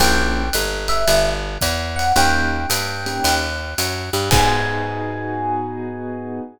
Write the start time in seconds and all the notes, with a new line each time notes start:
0.00 A#1 A#3 C#4 E4 G4 G5, kick, ride
0.53 G1, hi-hat pedal, ride
0.88 E5, ride
1.08 G1, ride
1.61 E2, kick, hi-hat pedal, ride
1.96 F#5, ride
2.16 D#2 A#3 C#4 D#4 G4 G5, ride
2.70 G2, hi-hat pedal, ride
3.06 A#3 C#4 D#4 G4, ride
3.24 D#2, ride
3.78 F#2, hi-hat pedal, ride
4.13 G2, ride
4.31 G#2 B3 D#4 F#4 G#4 G#5, kick, crash